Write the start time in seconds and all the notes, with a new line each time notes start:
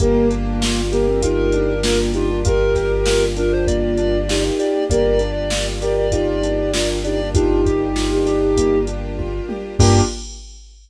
0.00 G1 A#3 D4 F4 G4 A#4, kick, closed hi-hat
0.30 D4, closed hi-hat
0.61 F4, snare
0.92 A#3 G4 A#4, closed hi-hat
1.07 C4
1.22 D#4 F4 G4 A#4, kick, closed hi-hat
1.52 D4, closed hi-hat
1.83 A#3 D4 F4, snare
2.13 D4 D#4 F4 G4, closed hi-hat
2.45 F4 G4 A#4, kick, closed hi-hat
2.75 G4, kick, snare, closed hi-hat
3.06 F4, snare
3.36 D4 F4 A#4, closed hi-hat
3.52 C5
3.67 A#3 D5, kick, closed hi-hat
3.97 D4, closed hi-hat
4.29 D#4 F4 G4, snare
4.59 G4 D5, closed hi-hat
4.90 G1 A#3 D4 F4 G4 A#4 D5, kick, closed hi-hat
5.19 D4, closed hi-hat
5.50 F4, snare
5.81 G4 A#4 D5, closed hi-hat
5.97 D5
6.12 D#4 F4 G4 D5, kick, closed hi-hat
6.43 D4, closed hi-hat
6.73 A#3 D4 F4, snare
7.04 D4 D#4 G4 D5, closed hi-hat
7.34 D4 D#4 F4 G4, kick, closed hi-hat
7.65 G4, kick, closed hi-hat
7.96 F4, snare
8.26 D4 G4, snare, closed hi-hat
8.57 A#3, kick, closed hi-hat
8.87 D4, closed hi-hat
9.18 F4, kick, high tom
9.49 G4, high tom
9.79 G2 A#3 D4 F4 G4, kick, crash